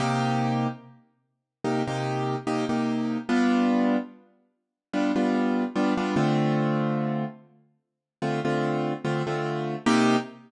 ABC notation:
X:1
M:4/4
L:1/16
Q:"Swing 16ths" 1/4=73
K:Cdor
V:1 name="Acoustic Grand Piano"
[C,B,EG]8 [C,B,EG] [C,B,EG]3 [C,B,EG] [C,B,EG]3 | [G,=B,DF]8 [G,B,DF] [G,B,DF]3 [G,B,DF] [G,B,DF] [D,A,CF]2- | [D,A,CF]8 [D,A,CF] [D,A,CF]3 [D,A,CF] [D,A,CF]3 | [C,B,EG]4 z12 |]